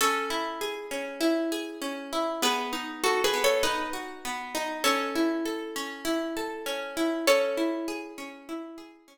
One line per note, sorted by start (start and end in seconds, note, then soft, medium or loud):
0.01 0.91 C#4 medium
0.01 2.04 A4 medium
0.01 2.04 C#5 medium
0.30 1.20 E4 medium
0.61 1.51 G#4 medium
0.91 1.81 C#4 medium
1.21 2.12 E4 medium
1.52 2.38 G#4 medium
1.82 2.39 C#4 medium
2.13 2.41 E4 medium
2.42 3.33 B3 medium
2.42 2.72 G#4 medium
2.42 2.72 B4 medium
2.73 3.63 D#4 medium
3.04 3.23 F#4 medium
3.04 3.23 A4 medium
3.24 3.43 G#4 medium
3.24 3.43 B4 medium
3.34 4.24 B3 medium
3.44 3.63 A4 medium
3.44 3.63 C#5 medium
3.63 4.54 D#4 medium
3.63 3.90 B4 medium
3.63 3.90 D#5 medium
3.93 4.80 F#4 medium
4.25 4.83 B3 medium
4.55 4.83 D#4 medium
4.84 5.75 C#4 medium
4.84 6.95 A4 medium
4.84 6.95 C#5 medium
5.16 6.04 E4 medium
5.45 6.36 A4 medium
5.76 6.66 C#4 medium
6.05 6.96 E4 medium
6.37 7.23 A4 medium
6.66 7.24 C#4 medium
6.97 7.26 E4 medium
7.27 8.17 C#4 medium
7.27 8.51 A4 medium
7.27 8.51 C#5 medium
7.57 8.48 E4 medium
7.88 8.77 G#4 medium
8.18 9.07 C#4 medium
8.49 9.18 E4 medium
8.78 9.18 G#4 medium
9.08 9.18 C#4 medium